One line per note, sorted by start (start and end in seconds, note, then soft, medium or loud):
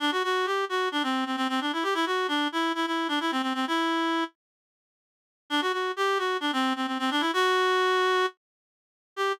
0.00 0.11 D4 loud
0.12 0.23 F#4 loud
0.24 0.46 F#4 loud
0.46 0.65 G4 medium
0.69 0.89 F#4 loud
0.92 1.03 D4 loud
1.03 1.24 C4 loud
1.26 1.36 C4 medium
1.37 1.47 C4 loud
1.49 1.60 C4 loud
1.61 1.72 D4 medium
1.73 1.84 E4 medium
1.83 1.94 G4 loud
1.94 2.05 E4 loud
2.06 2.27 F#4 loud
2.28 2.48 D4 loud
2.52 2.72 E4 loud
2.75 2.86 E4 loud
2.87 3.07 E4 medium
3.08 3.19 D4 loud
3.20 3.31 E4 loud
3.31 3.42 C4 loud
3.42 3.53 C4 medium
3.54 3.65 C4 loud
3.67 4.24 E4 loud
5.50 5.61 D4 loud
5.61 5.72 F#4 loud
5.73 5.92 F#4 medium
5.96 6.18 G4 loud
6.18 6.37 F#4 medium
6.40 6.51 D4 loud
6.53 6.73 C4 loud
6.76 6.86 C4 medium
6.87 6.98 C4 medium
6.99 7.10 C4 loud
7.11 7.22 D4 loud
7.20 7.31 E4 loud
7.33 8.26 F#4 loud
9.16 9.32 G4 loud